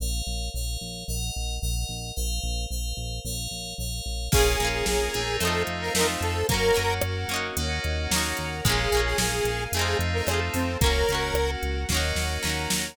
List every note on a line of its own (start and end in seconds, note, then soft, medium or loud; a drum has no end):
0.00 0.22 A#1 medium
0.00 0.48 A#4 medium
0.00 0.48 C#5 medium
0.00 0.48 F5 medium
0.27 0.50 A#1 medium
0.54 0.77 A#1 medium
0.54 1.03 A#4 medium
0.54 1.03 C#5 medium
0.54 1.03 F5 medium
0.81 1.04 A#1 medium
1.08 1.31 A#1 medium
1.08 1.56 A#4 medium
1.08 1.56 D#5 medium
1.08 1.56 F#5 medium
1.36 1.59 A#1 medium
1.62 1.85 A#1 medium
1.62 2.10 A#4 medium
1.62 2.10 D#5 medium
1.62 2.10 F#5 medium
1.89 2.12 A#1 medium
2.16 2.40 A#1 medium
2.16 2.65 A#4 medium
2.16 2.65 C5 medium
2.16 2.65 F5 medium
2.43 2.66 A#1 medium
2.70 2.93 A#1 medium
2.70 3.19 A#4 medium
2.70 3.19 C5 medium
2.70 3.19 F5 medium
2.97 3.20 A#1 medium
3.25 3.48 A#1 medium
3.25 3.73 A#4 medium
3.25 3.73 C#5 medium
3.25 3.73 F5 medium
3.51 3.74 A#1 medium
3.78 4.01 A#1 medium
3.78 4.27 A#4 medium
3.78 4.27 C#5 medium
3.78 4.27 F5 medium
4.06 4.29 A#1 medium
4.32 4.56 A#1 medium
4.32 4.57 A#3 medium
4.32 5.10 A#3 medium
4.32 5.10 C#4 medium
4.32 4.57 C#4 medium
4.32 5.10 F4 medium
4.32 4.69 G#4 medium
4.32 5.10 G#4 medium
4.32 4.86 A#4 medium
4.32 4.86 C#5 medium
4.32 4.86 F5 medium
4.32 4.86 G#5 medium
4.32 kick loud
4.32 crash loud
4.36 4.57 F4 medium
4.36 4.57 G#4 medium
4.60 4.83 A#1 medium
4.60 5.35 A#3 medium
4.60 5.35 C#4 medium
4.60 closed hi-hat medium
4.65 5.35 F4 medium
4.65 5.35 G#4 medium
4.73 4.86 G#4 medium
4.86 5.09 A#1 medium
4.86 5.37 G#4 medium
4.86 5.40 A#4 medium
4.86 5.40 C#5 medium
4.86 5.40 G#5 medium
4.86 5.40 A#5 medium
4.86 snare loud
5.13 5.38 A#1 medium
5.13 6.37 A3 medium
5.13 6.37 C4 medium
5.13 6.37 D#4 medium
5.13 6.37 F4 medium
5.13 closed hi-hat medium
5.40 5.64 F2 medium
5.40 5.90 A3 medium
5.40 5.90 C4 medium
5.40 5.94 A4 medium
5.40 5.63 A4 medium
5.40 5.94 C5 medium
5.40 5.94 D#5 medium
5.40 5.94 F5 medium
5.40 closed hi-hat medium
5.45 5.90 D#4 medium
5.45 5.90 F4 medium
5.67 5.90 F2 medium
5.67 closed hi-hat medium
5.81 5.94 A#4 medium
5.94 6.17 F2 medium
5.94 6.46 A3 medium
5.94 6.48 A4 medium
5.94 6.07 A#4 medium
5.94 6.48 C5 medium
5.94 6.48 F5 medium
5.94 6.48 A5 medium
5.94 snare loud
5.98 6.46 C4 medium
5.98 6.46 D#4 medium
6.03 6.46 F4 medium
6.20 6.43 F2 medium
6.20 6.47 A4 medium
6.20 closed hi-hat medium
6.49 6.72 F#2 medium
6.49 7.46 A#3 medium
6.49 6.74 A#3 medium
6.49 7.46 C#4 medium
6.49 6.74 C#4 medium
6.49 7.46 F#4 medium
6.49 6.94 A#4 loud
6.49 7.02 A#4 medium
6.49 7.02 C#5 medium
6.49 7.02 F#5 medium
6.49 kick loud
6.49 closed hi-hat loud
6.54 6.74 F#4 medium
6.74 7.00 F#2 medium
6.74 7.26 A#3 medium
6.74 7.26 C#4 medium
6.74 closed hi-hat medium
6.79 7.26 F#4 medium
7.01 7.25 F#2 medium
7.01 7.56 F#4 medium
7.01 7.56 A#4 medium
7.01 7.56 F#5 medium
7.01 cross-stick loud
7.28 7.51 F#2 medium
7.28 8.06 A#3 medium
7.28 8.06 C#4 medium
7.28 closed hi-hat medium
7.34 8.06 D#4 medium
7.34 8.06 F#4 medium
7.57 7.80 D#2 medium
7.57 8.54 A#3 medium
7.57 8.54 C#4 medium
7.57 8.54 D#4 medium
7.57 8.54 F#4 medium
7.57 8.10 A#4 medium
7.57 8.10 C#5 medium
7.57 8.10 D#5 medium
7.57 8.10 F#5 medium
7.57 closed hi-hat loud
7.84 8.08 D#2 medium
7.84 closed hi-hat medium
8.11 8.34 D#2 medium
8.11 8.61 A#3 medium
8.11 8.61 C#4 medium
8.11 8.64 A#4 medium
8.11 8.64 C#5 medium
8.11 8.64 F#5 medium
8.11 8.64 A#5 medium
8.11 snare loud
8.16 8.61 D#4 medium
8.16 8.61 F#4 medium
8.37 8.62 D#2 medium
8.37 closed hi-hat medium
8.64 8.88 A#1 medium
8.64 9.61 G#3 medium
8.64 8.90 G#3 loud
8.64 9.61 A#3 medium
8.64 8.90 A#3 medium
8.64 9.61 C#4 medium
8.64 9.61 F4 medium
8.64 9.01 G#4 medium
8.64 9.18 G#4 medium
8.64 9.18 A#4 medium
8.64 9.18 C#5 medium
8.64 9.18 F5 medium
8.64 kick loud
8.64 closed hi-hat loud
8.69 8.90 C#4 loud
8.69 8.90 F4 medium
8.92 9.15 A#1 medium
8.92 9.67 G#3 medium
8.92 9.67 A#3 medium
8.92 closed hi-hat medium
8.97 9.67 C#4 medium
8.97 9.67 F4 medium
9.05 9.18 G#4 medium
9.18 9.41 A#1 medium
9.18 9.64 G#4 medium
9.18 9.72 G#4 medium
9.18 9.72 A#4 medium
9.18 9.72 F5 medium
9.18 9.72 G#5 medium
9.18 snare loud
9.44 9.67 A#1 medium
9.44 closed hi-hat medium
9.72 9.95 F2 medium
9.72 10.70 A3 medium
9.72 10.24 A3 medium
9.72 10.70 C4 medium
9.72 10.70 D#4 medium
9.72 10.70 F4 medium
9.72 9.97 G#4 medium
9.72 10.26 A4 medium
9.72 10.26 C5 medium
9.72 10.27 D#5 medium
9.72 10.26 F5 medium
9.72 closed hi-hat loud
9.77 10.24 C4 medium
9.77 10.24 D#4 medium
9.81 10.24 F4 medium
9.99 10.22 F2 medium
9.99 closed hi-hat medium
10.14 10.27 A#4 medium
10.27 10.50 F2 medium
10.27 10.76 A3 medium
10.27 10.76 C4 medium
10.27 10.40 G#4 medium
10.27 10.80 A4 medium
10.27 10.80 C5 medium
10.27 10.80 F5 medium
10.27 10.80 A5 medium
10.27 cross-stick loud
10.31 10.76 D#4 medium
10.31 10.76 F4 medium
10.54 10.77 F2 medium
10.54 10.78 C4 medium
10.54 open hi-hat medium
10.81 11.04 C#2 medium
10.81 11.78 A#3 medium
10.81 11.06 A#3 medium
10.81 11.78 C#4 medium
10.81 11.06 C#4 medium
10.81 11.78 F#4 medium
10.81 11.34 A#4 medium
10.81 11.51 A#4 medium
10.81 11.34 C#5 medium
10.81 11.34 F#5 medium
10.81 kick loud
10.81 closed hi-hat loud
10.86 11.06 F#4 medium
11.09 11.32 C#2 medium
11.09 11.85 A#3 medium
11.09 11.85 C#4 medium
11.09 closed hi-hat medium
11.15 11.85 F#4 medium
11.34 11.57 C#2 medium
11.34 11.88 F#4 medium
11.34 11.88 A#4 medium
11.34 11.88 F#5 medium
11.34 cross-stick loud
11.63 11.85 C#2 medium
11.63 closed hi-hat medium
11.89 12.13 D#2 medium
11.89 12.87 A#3 medium
11.89 12.40 A#3 medium
11.89 12.87 C#4 medium
11.89 12.40 C#4 medium
11.89 12.87 D#4 medium
11.89 12.87 F#4 medium
11.89 12.43 A#4 medium
11.89 12.43 C#5 medium
11.89 12.43 D#5 medium
11.89 12.43 F#5 medium
11.89 kick medium
11.89 snare medium
11.94 12.40 D#4 medium
11.94 12.40 F#4 medium
12.15 12.38 D#2 medium
12.15 snare medium
12.43 12.67 D#2 medium
12.43 12.92 A#3 medium
12.43 12.92 C#4 medium
12.43 12.96 A#4 medium
12.43 12.96 C#5 medium
12.43 12.96 F#5 medium
12.43 12.96 A#5 medium
12.43 snare medium
12.47 12.92 D#4 medium
12.47 12.92 F#4 medium
12.70 12.95 D#2 medium
12.70 snare loud